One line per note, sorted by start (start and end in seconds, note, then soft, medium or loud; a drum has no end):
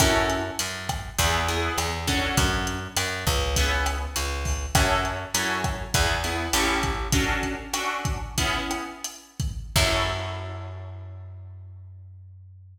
0.00 0.51 F#2 medium
0.00 0.41 C#4 loud
0.00 0.41 E4 loud
0.00 0.41 F#4 loud
0.00 0.41 A4 loud
0.00 kick loud
0.00 cross-stick loud
0.00 closed hi-hat loud
0.30 closed hi-hat medium
0.59 1.10 F#2 medium
0.59 closed hi-hat loud
0.89 kick medium
0.89 cross-stick loud
0.89 closed hi-hat medium
1.18 1.69 E2 loud
1.18 1.39 B3 loud
1.18 1.39 E4 loud
1.18 1.39 G#4 loud
1.18 kick medium
1.18 closed hi-hat loud
1.48 1.90 B3 loud
1.48 1.90 E4 medium
1.48 1.90 G#4 loud
1.48 closed hi-hat medium
1.78 2.28 E2 medium
1.78 cross-stick loud
1.78 closed hi-hat loud
2.07 2.79 C#4 loud
2.07 2.79 D4 loud
2.07 2.79 F#4 loud
2.07 2.79 A4 loud
2.07 kick medium
2.07 closed hi-hat loud
2.37 2.88 F#2 medium
2.37 kick loud
2.37 closed hi-hat loud
2.67 closed hi-hat medium
2.97 3.25 F#2 medium
2.97 cross-stick loud
2.97 closed hi-hat loud
3.27 4.07 C#2 medium
3.27 kick loud
3.27 closed hi-hat medium
3.56 3.99 B3 loud
3.56 3.99 C#4 loud
3.56 3.99 E4 loud
3.56 3.99 G#4 loud
3.56 kick medium
3.56 closed hi-hat loud
3.86 cross-stick loud
3.86 closed hi-hat medium
4.16 4.66 C#2 medium
4.16 closed hi-hat loud
4.45 kick medium
4.45 open hi-hat medium
4.75 5.25 F#2 medium
4.75 5.17 C#4 loud
4.75 5.17 E4 loud
4.75 5.17 F#4 loud
4.75 5.17 A4 loud
4.75 kick loud
4.75 cross-stick loud
4.75 closed hi-hat loud
5.05 closed hi-hat medium
5.34 5.85 F#2 medium
5.34 5.77 C#4 loud
5.34 5.77 E4 medium
5.34 5.77 F#4 medium
5.34 5.77 A4 medium
5.34 closed hi-hat loud
5.64 kick medium
5.64 cross-stick loud
5.64 closed hi-hat medium
5.94 6.49 E2 medium
5.94 6.15 B3 loud
5.94 6.15 E4 loud
5.94 6.15 G#4 loud
5.94 kick loud
5.94 closed hi-hat loud
6.24 6.45 B3 loud
6.24 6.45 E4 medium
6.24 6.45 G#4 medium
6.24 closed hi-hat medium
6.53 7.08 A1 medium
6.53 6.95 C#4 loud
6.53 6.95 E4 loud
6.53 6.95 G4 loud
6.53 6.95 A4 loud
6.53 cross-stick medium
6.53 closed hi-hat loud
6.83 kick medium
6.83 closed hi-hat medium
7.12 7.55 C#4 loud
7.12 7.55 D4 loud
7.12 7.55 F#4 loud
7.12 7.55 A4 loud
7.12 kick loud
7.12 closed hi-hat loud
7.43 kick medium
7.43 closed hi-hat medium
7.73 8.18 C#4 loud
7.73 8.18 D4 loud
7.73 8.18 F#4 loud
7.73 8.18 A4 loud
7.73 cross-stick loud
7.73 closed hi-hat loud
8.05 kick loud
8.05 closed hi-hat medium
8.38 8.85 B3 loud
8.38 8.85 C#4 loud
8.38 8.85 E4 loud
8.38 8.85 G#4 loud
8.38 kick medium
8.38 closed hi-hat loud
8.71 cross-stick loud
8.71 closed hi-hat medium
9.04 closed hi-hat loud
9.40 kick loud
9.40 closed hi-hat medium
9.76 12.79 F#2 loud
9.76 12.79 C#4 medium
9.76 12.79 E4 loud
9.76 12.79 F#4 loud
9.76 12.79 A4 loud
9.76 kick loud
9.76 crash loud